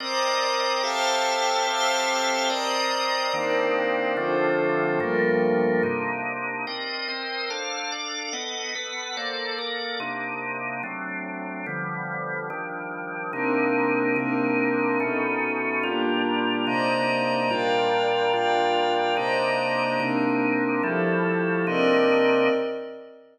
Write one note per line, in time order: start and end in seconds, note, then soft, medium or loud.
0.00 0.83 C4 medium
0.00 0.83 A#4 medium
0.00 0.82 C5 medium
0.00 0.83 D5 loud
0.00 0.83 D#5 medium
0.00 0.82 A#5 medium
0.00 0.82 D6 medium
0.00 0.82 D#6 medium
0.83 1.66 C4 medium
0.83 1.66 G4 medium
0.83 1.66 A4 loud
0.83 1.66 C5 medium
0.83 1.66 E5 medium
0.83 1.66 F5 medium
0.83 1.66 G5 medium
0.83 1.66 A5 medium
0.83 1.66 E6 medium
0.83 1.66 F6 medium
1.67 2.49 C4 loud
1.67 2.49 G4 loud
1.67 2.49 A4 medium
1.67 2.49 C5 medium
1.67 2.49 E5 medium
1.67 2.49 F5 medium
1.67 2.49 G5 medium
1.67 2.49 A5 medium
1.67 2.49 E6 medium
1.67 2.49 F6 medium
2.50 3.32 C4 medium
2.50 3.32 A#4 medium
2.50 3.33 C5 medium
2.50 3.32 D5 loud
2.50 3.33 D5 medium
2.50 3.32 D#5 medium
2.50 3.33 A#5 medium
2.50 3.33 D#6 medium
3.33 4.16 D#3 loud
3.33 4.16 A#3 loud
3.33 4.16 C4 loud
3.33 4.16 D4 medium
3.33 4.16 D#4 medium
3.33 4.16 A#4 medium
3.33 4.16 C5 medium
3.33 4.16 D5 medium
4.16 4.99 D3 medium
4.16 4.99 F3 loud
4.16 4.99 A3 medium
4.16 4.99 C4 medium
4.16 4.99 D4 medium
4.16 4.99 F4 medium
4.16 4.99 A4 medium
4.16 4.99 C5 medium
5.00 5.83 G2 loud
5.00 5.83 F3 loud
5.00 5.82 G3 medium
5.00 5.83 A3 medium
5.00 5.83 A#3 loud
5.00 5.82 F4 medium
5.00 5.82 A4 medium
5.00 5.82 A#4 medium
5.83 6.66 C3 medium
5.83 6.66 A#3 medium
5.83 6.66 D4 medium
5.83 6.66 D#4 medium
6.67 7.08 C4 medium
6.67 7.08 A#4 medium
6.67 7.08 D5 medium
6.67 7.08 D#5 medium
7.08 7.49 C4 medium
7.08 7.49 A#4 medium
7.08 7.49 C5 medium
7.08 7.49 D#5 medium
7.50 7.91 D4 medium
7.50 7.91 A4 medium
7.50 7.91 C5 medium
7.50 7.91 F5 medium
7.92 8.33 D4 medium
7.92 8.32 A4 medium
7.92 8.33 D5 medium
7.92 8.33 F5 medium
8.33 8.74 B3 medium
8.33 8.74 A4 medium
8.33 8.74 D#5 medium
8.33 8.74 F#5 medium
8.75 9.16 B3 medium
8.75 9.16 A4 medium
8.75 9.16 B4 medium
8.75 9.16 F#5 medium
9.17 9.58 A#3 medium
9.17 9.58 A4 medium
9.17 9.58 C5 medium
9.17 9.58 D5 medium
9.58 9.99 A#3 medium
9.58 10.00 A4 medium
9.58 10.00 A#4 medium
9.58 10.00 D5 medium
10.00 10.82 C3 medium
10.00 10.82 A#3 medium
10.00 10.82 D4 medium
10.00 10.82 D#4 medium
10.83 11.66 F#3 medium
10.83 11.66 A3 medium
10.83 11.66 C4 medium
10.83 11.66 D4 medium
11.66 12.49 D3 medium
11.66 12.49 F3 medium
11.66 12.49 G3 medium
11.66 12.49 B3 medium
12.50 13.32 D#3 medium
12.50 13.32 F3 medium
12.50 13.32 G3 medium
12.50 13.32 D4 medium
13.33 14.15 C3 medium
13.33 14.15 A#3 medium
13.33 14.15 C4 medium
13.33 14.15 D4 medium
13.33 14.15 D#4 medium
13.33 14.15 D#4 loud
13.33 14.15 A#4 medium
14.16 14.99 C3 medium
14.16 14.99 A#3 medium
14.16 14.99 C4 medium
14.16 14.99 D4 loud
14.16 14.99 D4 medium
14.16 14.99 D#4 loud
14.16 14.99 D#4 medium
14.16 14.99 A#4 medium
15.00 15.82 B2 medium
15.00 15.82 A3 medium
15.00 15.83 B3 medium
15.00 15.82 C#4 loud
15.00 15.83 C#4 medium
15.00 15.82 D#4 loud
15.00 15.83 D#4 medium
15.00 15.83 A4 medium
15.83 16.66 A#2 loud
15.83 16.66 G3 loud
15.83 16.66 A#3 medium
15.83 16.66 D4 medium
15.83 16.66 F4 loud
15.83 16.66 F4 medium
15.83 16.66 G4 medium
16.67 17.49 C3 loud
16.67 17.49 A#3 medium
16.67 17.49 D4 medium
16.67 17.49 D#4 loud
16.67 17.50 C5 medium
16.67 17.50 D5 medium
16.67 17.50 D#5 medium
16.67 17.50 A#5 medium
17.50 18.33 A#2 loud
17.50 18.33 G3 medium
17.50 18.33 D4 loud
17.50 18.33 F4 medium
17.50 18.33 A#4 medium
17.50 18.33 D5 medium
17.50 18.33 F5 medium
17.50 18.33 G5 medium
18.33 19.16 A#2 loud
18.33 19.16 G3 medium
18.33 19.16 D4 medium
18.33 19.16 F4 medium
18.33 19.16 A#4 medium
18.33 19.16 D5 medium
18.33 19.16 F5 medium
18.33 19.16 G5 medium
19.17 19.99 C3 loud
19.17 19.99 A#3 loud
19.17 19.99 D4 loud
19.17 19.99 D#4 medium
19.17 20.00 C5 medium
19.17 20.00 D5 medium
19.17 20.00 D#5 medium
19.17 20.00 A#5 medium
19.99 20.82 C3 loud
19.99 20.82 A#3 loud
19.99 20.82 C4 medium
19.99 20.82 D4 medium
19.99 20.82 D#4 medium
19.99 20.82 A#4 medium
20.83 21.66 F3 medium
20.83 21.66 G3 loud
20.83 21.66 A3 loud
20.83 21.66 E4 medium
20.83 21.66 G4 medium
20.83 21.66 A4 medium
21.67 22.49 C3 loud
21.67 22.49 A#3 medium
21.67 22.49 C4 loud
21.67 22.49 D4 loud
21.67 22.49 D#4 loud
21.67 22.49 A#4 medium
21.67 22.49 D5 medium
21.67 22.49 D#5 medium